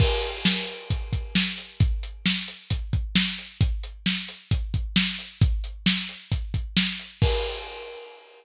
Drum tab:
CC |x-------|--------|--------|--------|
HH |-x-xxx-x|xx-xxx-x|xx-xxx-x|xx-xxx-x|
SD |--o---o-|--o---o-|--o---o-|--o---o-|
BD |o---oo--|o---oo--|o---oo--|o---oo--|

CC |x-------|
HH |--------|
SD |--------|
BD |o-------|